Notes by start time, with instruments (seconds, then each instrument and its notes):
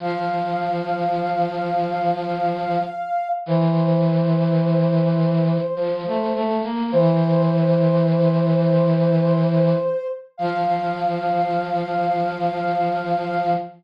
0.00 brass section F3, ocarina F5
3.46 brass section E3, ocarina C5
5.76 brass section F3
6.06 brass section A3
6.35 brass section A3
6.64 brass section A#3
6.92 brass section E3, ocarina C5
10.37 brass section F3, ocarina F5